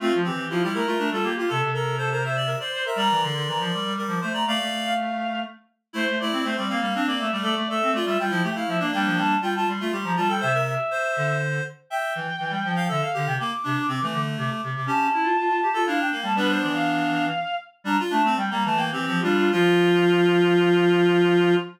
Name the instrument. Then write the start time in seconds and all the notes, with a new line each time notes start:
clarinet
0.00 A3 C4 F4
0.15 F3
0.24 E3 C4 G4
0.36 E3
0.50 F3 E4 F4
0.62 G3 E4 G4
0.74 A3 E4 A#4
0.86 A3 F4
0.98 A3 D4
1.11 G3 F4 A4
1.23 A#3 G4
1.36 F4 G4
1.49 C3 A4
1.63 C3
1.73 A4 A#4
1.98 A4 C5
2.11 A#4 C5
2.24 C5 E5
2.36 D5
2.46 A#4
2.60 C5 D5
2.73 C5
2.85 A#4 E5
2.96 G3 A#4 D5 A#5
3.11 E3
3.22 D3 C6
3.35 D3
3.47 E3 A#5
3.59 F3 C6
3.72 G3 D6
3.85 G3
3.97 G3 A#4
4.07 F3 D6
4.21 A3 C5 C6
4.33 D5 A#5
4.47 A3 D5 F5
4.61 A3
4.84 F5
5.93 A3 E4 C5
6.09 A3
6.20 A3 E4 D5
6.32 C4
6.43 A3 C4 C5
6.56 G3 C4 D5
6.68 A#3 C4 F5
6.81 G3 A#3
6.95 C4 D4
7.07 A#3 D5
7.19 A3 E5
7.31 G3 A3 D5
7.43 A3 A4 D5
7.57 A3
7.69 A3 A4 E5
7.83 C4
7.92 A3 F4 D5
8.05 G3 F4 E5
8.18 G3 F4 G5
8.30 F3 E4
8.43 A3 G4
8.55 E4 F5
8.67 F3 E5
8.79 A#3 D4 D5
8.92 G3 A#3 D4 G5
9.05 F3
9.17 G3 A5
9.41 G3 F4 G5
9.54 F4 A5
9.67 G3 C6
9.80 A3 F4
9.92 G3 G4
10.04 F3 A#5
10.16 G3 F4 A5
10.28 A4 G5
10.40 C3 C5 E5
10.54 A#4
10.66 E5
10.91 C5
11.17 D3
11.90 E5 G5
12.15 E3
12.40 E3
12.50 G3
12.65 F3
12.76 F5
12.88 D3 A4 E5
13.01 F5
13.14 D3 G4
13.26 C3 G5
13.39 A#3 D6
13.64 C3 D4
13.88 C3 C4
14.01 E3 A3
14.13 D3
14.38 C3 D6
14.50 D6
14.64 C3
14.75 C3 D6
14.86 C#4 G4 A5
15.14 E4
15.24 F4
15.39 F4
15.49 F4
15.63 G4
15.74 F4 A4
15.85 D4 E4 F5
16.00 D4 G5
16.11 A#3
16.23 G3 A5
16.35 G3 B3 D4 B4
16.49 C5
16.61 E3 D5
16.74 F5
17.84 G3 D4 A#5
18.00 F4
18.10 A3 D4 A5
18.22 A3 C4
18.36 G3 G5
18.50 G3 A#3 A#5
18.64 E3 A3 A5
18.77 A#3 G5
18.92 E3 C4 G4
19.06 F3 C4
19.21 G3 D4 F4
19.37 F4
19.52 F3 F4